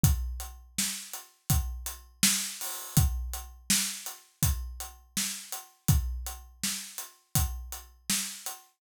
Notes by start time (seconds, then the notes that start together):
0.04 kick, closed hi-hat
0.40 closed hi-hat
0.78 snare
1.13 closed hi-hat
1.50 kick, closed hi-hat
1.86 closed hi-hat
2.23 snare
2.61 open hi-hat
2.97 kick, closed hi-hat
3.33 closed hi-hat
3.70 snare
4.06 closed hi-hat
4.43 kick, closed hi-hat
4.80 closed hi-hat
5.17 snare
5.52 closed hi-hat
5.88 kick, closed hi-hat
6.27 closed hi-hat
6.63 snare
6.98 closed hi-hat
7.35 kick, closed hi-hat
7.72 closed hi-hat
8.10 snare
8.46 closed hi-hat